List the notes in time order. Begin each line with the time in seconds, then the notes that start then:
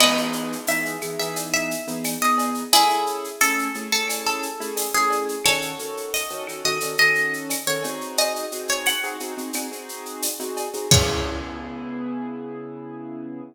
0.00 E3 B3 D#4 G#4 B4 D#5, crash, cowbell, claves
0.17 shaker
0.33 shaker
0.52 shaker
0.67 E3 B3 D#4 G#4 E5, tambourine, shaker
0.86 shaker
1.01 E3 B3 D#4 G#4, claves, shaker
1.19 E3 B3 D#4 G#4 E5, shaker
1.36 cowbell, shaker
1.53 E5, shaker
1.71 shaker
1.87 E3 B3 D#4 G#4, shaker
2.04 tambourine, cowbell, claves, shaker
2.22 E3 B3 D#4 G#4 D#5, shaker
2.38 cowbell, shaker
2.54 shaker
2.73 A3 C#4 E4 G#4, cowbell, shaker
2.90 shaker
3.06 shaker
3.24 shaker
3.41 A3 C#4 E4 G#4 A4, tambourine, claves, shaker
3.59 shaker
3.74 A3 C#4 E4 G#4, shaker
3.92 A3 C#4 E4 G#4 A4, shaker
4.08 cowbell, claves, shaker
4.26 A4, shaker
4.43 shaker
4.60 A3 C#4 E4 G#4, shaker
4.77 tambourine, cowbell, shaker
4.94 A3 C#4 E4 G#4, shaker
5.10 cowbell, shaker
5.29 shaker
5.45 D#3 C#4 F#4 A4 C#5, cowbell, claves, shaker
5.62 shaker
5.79 D#3 C#4 F#4 A4, shaker
5.97 shaker
6.13 D#5, tambourine, shaker
6.30 D#3 C#4 F#4 A4, shaker
6.47 D#3 C#4 F#4 A4, claves, shaker
6.64 D#3 C#4 F#4 A4 D#5, shaker
6.80 D#3 C#4 F#4 A4, cowbell, shaker
6.98 D#3 C#4 F#4 A4 D#5, shaker
7.15 shaker
7.33 shaker
7.49 tambourine, cowbell, claves, shaker
7.67 D#3 C#4 F#4 A4 C#5, shaker
7.83 C4 D#4 F#4 G#4, cowbell, shaker
8.01 shaker
8.17 D#5, cowbell, shaker
8.36 shaker
8.52 C4 D#4 F#4 G#4, shaker
8.68 C#5, shaker
8.86 F#5, tambourine, claves, shaker
9.03 C4 D#4 F#4 G#4, shaker
9.20 C4 D#4 F#4 G#4, shaker
9.37 C4 D#4 F#4 G#4, shaker
9.53 C4 D#4 F#4 G#4, cowbell, claves, shaker
9.72 C4 D#4 F#4 G#4, shaker
9.89 shaker
10.06 shaker
10.22 tambourine, cowbell, shaker
10.40 C4 D#4 F#4 G#4, shaker
10.57 cowbell, shaker
10.73 C4 D#4 F#4 G#4, shaker
10.91 C#3 B3 E4 G#4 C#5, kick, crash